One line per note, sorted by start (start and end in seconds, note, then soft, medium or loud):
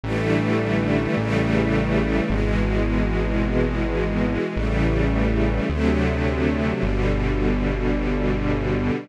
0.04 1.08 A1 medium
0.04 1.16 D3 medium
0.04 1.16 E3 medium
0.04 1.16 G3 medium
0.04 1.16 A3 medium
1.17 2.21 A1 medium
1.17 2.29 C#3 medium
1.17 2.29 E3 medium
1.17 2.29 G3 medium
1.17 2.29 A3 medium
2.30 4.38 G#1 medium
2.30 4.54 B2 medium
2.30 4.54 E3 medium
2.30 4.54 G#3 medium
4.56 5.61 A1 medium
4.56 5.68 C#3 medium
4.56 5.68 E3 medium
4.56 5.68 G3 medium
4.56 5.68 A3 medium
5.70 6.74 D2 medium
5.70 6.82 C3 medium
5.70 6.82 D3 medium
5.70 6.82 F#3 medium
5.70 6.82 A3 medium
6.83 8.91 G1 loud
6.83 9.07 B2 medium
6.83 9.07 D3 medium
6.83 9.07 G3 medium